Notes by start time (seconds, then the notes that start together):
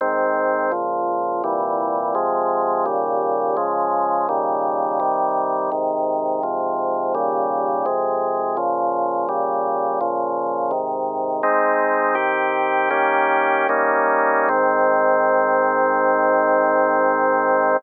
0.01 G#2 D#3 C4
0.72 C#2 A#2 F3
1.44 C2 A#2 E3 G3
2.15 C3 F3 G#3
2.86 D#2 A#2 C#3 G3
3.57 C#3 F3 G#3
4.29 A#2 C#3 D#3 G3
5.00 C3 D#3 G3
5.72 G#2 C3 D#3
6.43 G#2 C3 F3
7.15 D#2 A#2 C#3 G3
7.86 F2 C3 G#3
8.57 A#2 C#3 F3
9.29 A#2 C#3 G3
10.01 A#2 C#3 F3
10.71 G#2 C3 D#3
11.43 G#3 C4 D#4
12.15 D#3 C4 G4
12.90 D#3 A#3 C#4 G4
13.69 G3 A#3 C#4 D#4
14.49 G#2 D#3 C4